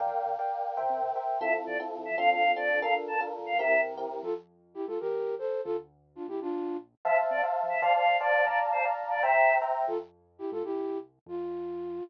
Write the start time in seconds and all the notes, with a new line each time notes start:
0.00 A#1 A#4 D5 F5 G5
0.07 F2
0.14 A#1
0.26 A#1
0.39 A#4 D5 F5 G5
0.77 C2 A#4 C5 E5 G5
0.81 C2
0.90 C3
1.02 C2
1.15 A#4 C5 E5 G5
1.40 F2 C4 E4 F4 A4 E5
1.47 F2
1.67 F2 D5
1.80 C4 E4 F4 A4
1.97 F2
2.05 E5
2.10 F3
2.17 D2 C4 D4 F4 A4 F5
2.24 D2
2.31 F5
2.42 D2
2.56 C4 D4 F4 A4 D5
2.75 D2
2.81 A#1 D4 F4 A4 A#4 F5
2.90 A#1
3.07 A#1 A5
3.20 D4 F4 A4 A#4
3.39 A#1
3.46 F5
3.53 A#2
3.59 C2 C4 E4 G4 A#4 E5
3.65 C2
3.85 C2
3.96 D#2 C4 E4 G4 A#4
4.10 E2
4.23 F2 F4 A4
4.74 E4 G4
4.87 G#2 F4 A4
5.00 E2 G4 A#4
5.38 A4 C5
5.64 D2 F4 A4
6.15 D4 F4
6.28 A#1 E4 G4
6.41 D4 F4
7.05 F2 C5 E5 F5 A5
7.13 F2
7.31 C3 D5
7.43 C5 E5 F5 A5
7.63 F2
7.69 E5
7.75 F2
7.82 D2 C5 D5 F5 A5
7.89 D2
7.95 F5
8.06 A2
8.20 C5 D5 F5 A5
8.41 D2
8.46 A#1 D5 F5 A5 A#5
8.51 A#1
8.72 A#1 C5
8.85 D5 F5 A5 A#5
9.03 A#1
9.10 D5
9.17 A#1
9.23 C2 C5 E5 G5 A#5
9.30 C2
9.48 C2
9.62 C5 E5 G5 A#5
9.81 C2
9.87 F2 F4 A4
10.38 E4 G4
10.51 G#2 F4 A4
10.64 C2 E4 G4
11.26 F2 F4